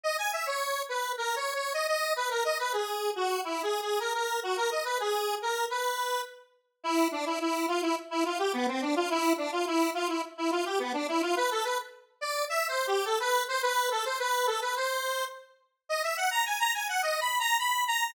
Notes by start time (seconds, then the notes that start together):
0.04 D#5
0.18 G#5
0.33 E5
0.47 C#5
0.89 B4
1.18 A#4
1.36 C#5
1.55 C#5
1.74 D#5
1.88 D#5
2.16 B4
2.30 A#4
2.45 D#5
2.59 B4
2.73 G#4
3.16 F#4
3.44 E4
3.63 G#4
3.82 G#4
4.00 A#4
4.14 A#4
4.43 F#4
4.57 A#4
4.71 D#5
4.85 B4
5.00 G#4
5.42 A#4
5.70 B4
6.84 E4
7.12 D4
7.26 E4
7.41 E4
7.68 F4
7.82 E4
8.11 E4
8.25 F4
8.39 G4
8.53 B3
8.68 C4
8.82 D4
8.96 F4
9.10 E4
9.38 D4
9.52 F4
9.67 E4
9.94 F4
10.08 E4
10.38 E4
10.51 F4
10.66 G4
10.79 B3
10.94 D4
11.08 E4
11.22 F4
11.37 B4
11.51 A4
11.65 B4
12.21 D5
12.49 E5
12.69 C5
12.87 G4
13.05 A4
13.20 B4
13.48 C5
13.63 B4
13.91 A4
14.05 C5
14.19 B4
14.47 A4
14.62 B4
14.76 C5
15.89 D#5
16.03 E5
16.17 F#5
16.31 A#5
16.46 G#5
16.60 A#5
16.74 G#5
16.89 F#5
17.02 D#5
17.21 B5
17.40 A#5
17.59 B5
17.88 A#5